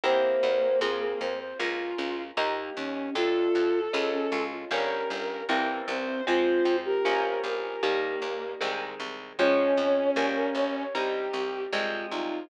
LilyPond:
<<
  \new Staff \with { instrumentName = "Flute" } { \time 4/4 \key f \minor \tempo 4 = 77 c''4 r16 aes'16 c''16 c''16 f'4 ees'8 des'8 | f'4 r16 des'16 f'16 f'16 des'4 c'8 c'8 | f'8. g'2~ g'16 r4 | des''4 r16 bes'16 des''16 des''16 g'4 f'8 ees'8 | }
  \new Staff \with { instrumentName = "Violin" } { \time 4/4 \key f \minor bes2 f'4 r8 des'8 | a'2 bes'4 r8 c''8 | c''8. bes'8. bes'8 bes4 r4 | des'2 g'4 r8 f'8 | }
  \new Staff \with { instrumentName = "Acoustic Guitar (steel)" } { \time 4/4 \key f \minor <c' e' g' bes'>4 <c' f' aes'>4 <bes des' f'>4 <bes ees' g'>4 | <a d' f'>4 <aes des' f'>4 <g bes des'>4 <e g bes c'>4 | <f aes c'>4 <f bes des'>4 <ees g bes>4 <ees aes c'>4 | <f aes des'>4 <g bes des'>4 <g c' ees'>4 <f aes c'>4 | }
  \new Staff \with { instrumentName = "Electric Bass (finger)" } { \clef bass \time 4/4 \key f \minor e,8 e,8 f,8 f,8 des,8 des,8 ees,8 ees,8 | f,8 f,8 des,8 des,8 g,,8 g,,8 c,8 c,8 | f,8 f,8 bes,,8 bes,,8 ees,8 ees,8 c,8 c,8 | f,8 f,8 bes,,8 bes,,8 c,8 c,8 c,8 c,8 | }
>>